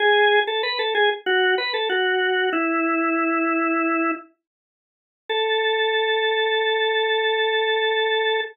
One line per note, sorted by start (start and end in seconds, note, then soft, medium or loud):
0.00 0.40 G#4 loud
0.47 0.62 A4 medium
0.63 0.78 B4 medium
0.79 0.94 A4 medium
0.95 1.10 G#4 loud
1.26 1.55 F#4 loud
1.58 1.73 B4 medium
1.74 1.89 A4 medium
1.89 2.50 F#4 medium
2.53 4.12 E4 loud
5.29 8.41 A4 loud